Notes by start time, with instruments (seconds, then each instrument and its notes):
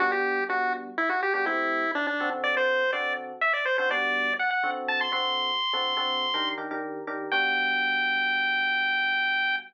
0.00 electric piano 1 G3 B3 D4 F#4, lead 1 (square) F#4
0.12 lead 1 (square) G4
0.49 electric piano 1 G3 B3 D4 F#4, lead 1 (square) F#4
0.98 lead 1 (square) E4
1.09 lead 1 (square) F#4
1.23 lead 1 (square) G4
1.34 electric piano 1 G3 B3 D4 F#4, lead 1 (square) G4
1.45 electric piano 1 A3 C4 E4 G4, lead 1 (square) E4
1.95 lead 1 (square) D4
2.07 lead 1 (square) D4
2.20 electric piano 1 D3 C4 F#4 A4
2.44 lead 1 (square) D5
2.57 lead 1 (square) C5
2.93 electric piano 1 D3 C4 F#4 A4, lead 1 (square) D5
3.41 lead 1 (square) E5
3.53 lead 1 (square) D5
3.65 lead 1 (square) C5
3.78 electric piano 1 D3 C4 F#4 A4, lead 1 (square) C5
3.90 electric piano 1 G3 B3 D4 F#4, lead 1 (square) D5
4.39 lead 1 (square) F#5
4.51 lead 1 (square) F#5
4.63 electric piano 1 D3 C4 F#4 A4
4.88 lead 1 (square) A5
5.01 lead 1 (square) C6
5.12 electric piano 1 D3 C4 F#4 A4, lead 1 (square) C6
5.73 electric piano 1 D3 C4 F#4 A4
5.97 electric piano 1 D3 C4 F#4 A4
6.34 electric piano 1 D#3 D4 G4 A#4
6.58 electric piano 1 D#3 D4 G4 A#4
6.71 electric piano 1 D#3 D4 G4 A#4
7.07 electric piano 1 D#3 D4 G4 A#4
7.32 electric piano 1 G3 B3 D4 F#4, lead 1 (square) G5